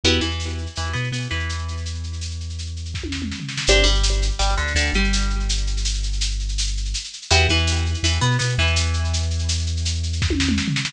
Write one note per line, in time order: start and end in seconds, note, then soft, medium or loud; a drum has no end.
0.04 0.19 E2 loud
0.04 0.21 B3 loud
0.04 0.21 E4 loud
0.04 0.21 F#4 loud
0.04 0.21 G4 loud
0.04 shaker medium
0.12 shaker medium
0.21 0.67 E2 medium
0.21 0.67 E3 medium
0.21 shaker medium
0.30 shaker soft
0.40 tambourine medium
0.40 shaker medium
0.49 shaker medium
0.58 shaker medium
0.66 shaker medium
0.75 0.93 E2 medium
0.75 0.92 E3 medium
0.75 shaker medium
0.84 shaker medium
0.93 1.10 B2 medium
0.93 1.09 B3 medium
0.93 shaker medium
1.03 shaker soft
1.12 1.27 B2 medium
1.12 1.28 B3 medium
1.12 tambourine medium
1.12 shaker medium
1.21 shaker medium
1.30 3.32 E2 medium
1.30 3.31 E3 medium
1.30 shaker medium
1.39 shaker medium
1.49 shaker medium
1.58 shaker medium
1.68 shaker medium
1.77 shaker medium
1.85 shaker medium
1.94 shaker medium
2.03 shaker medium
2.13 shaker medium
2.21 tambourine medium
2.21 shaker medium
2.30 shaker medium
2.40 shaker medium
2.49 shaker medium
2.58 shaker medium
2.66 shaker medium
2.76 shaker medium
2.85 shaker medium
2.94 kick medium
2.94 snare medium
3.03 high tom medium
3.12 snare medium
3.22 mid tom medium
3.32 snare medium
3.40 floor tom medium
3.48 snare medium
3.57 snare medium
3.67 3.84 G1 loud
3.67 3.85 C4 loud
3.67 3.85 D4 loud
3.67 3.85 G4 loud
3.67 shaker loud
3.76 shaker medium
3.83 4.31 G1 loud
3.83 4.30 G3 loud
3.83 shaker medium
3.95 shaker medium
4.03 tambourine medium
4.03 shaker loud
4.12 shaker medium
4.22 shaker loud
4.31 shaker medium
4.39 4.55 G1 loud
4.39 4.54 G3 loud
4.39 shaker loud
4.49 shaker medium
4.57 4.74 D2 loud
4.57 4.73 D3 medium
4.57 shaker medium
4.67 shaker medium
4.75 4.90 D2 loud
4.75 4.91 D3 loud
4.75 tambourine medium
4.75 shaker loud
4.86 shaker medium
4.93 6.94 G1 loud
4.93 6.96 G3 loud
4.93 shaker medium
5.04 shaker medium
5.13 shaker loud
5.21 shaker medium
5.30 shaker medium
5.40 shaker medium
5.49 shaker loud
5.57 shaker medium
5.67 shaker medium
5.77 shaker medium
5.85 tambourine medium
5.85 shaker loud
5.94 shaker medium
6.03 shaker medium
6.13 shaker medium
6.21 shaker loud
6.31 shaker medium
6.39 shaker medium
6.49 shaker medium
6.58 tambourine medium
6.58 shaker loud
6.67 shaker medium
6.77 shaker medium
6.85 shaker medium
6.94 shaker loud
7.04 shaker medium
7.13 shaker medium
7.22 shaker medium
7.30 7.47 E2 loud
7.30 7.47 B3 loud
7.30 7.47 E4 loud
7.30 7.47 F#4 loud
7.30 7.47 G4 loud
7.30 shaker loud
7.39 shaker medium
7.49 7.95 E2 loud
7.49 7.97 E3 loud
7.49 shaker medium
7.58 shaker medium
7.67 tambourine medium
7.67 shaker loud
7.76 shaker medium
7.86 shaker medium
7.94 shaker medium
8.03 8.18 E2 loud
8.03 8.19 E3 loud
8.03 shaker loud
8.12 shaker medium
8.21 8.37 B2 loud
8.21 8.37 B3 loud
8.21 shaker medium
8.31 shaker medium
8.39 8.56 B2 loud
8.39 8.54 B3 loud
8.39 tambourine medium
8.39 shaker loud
8.49 shaker medium
8.58 10.59 E2 loud
8.58 10.59 E3 loud
8.58 shaker medium
8.67 shaker medium
8.76 shaker loud
8.86 shaker medium
8.93 shaker medium
9.04 shaker medium
9.13 shaker loud
9.22 shaker medium
9.30 shaker medium
9.39 shaker medium
9.49 tambourine medium
9.49 shaker loud
9.59 shaker medium
9.66 shaker medium
9.77 shaker medium
9.85 shaker loud
9.94 shaker medium
10.03 shaker medium
10.13 shaker medium
10.22 kick medium
10.22 snare medium
10.30 high tom medium
10.40 snare medium
10.49 mid tom medium
10.58 snare medium
10.68 floor tom medium
10.76 snare medium
10.85 snare loud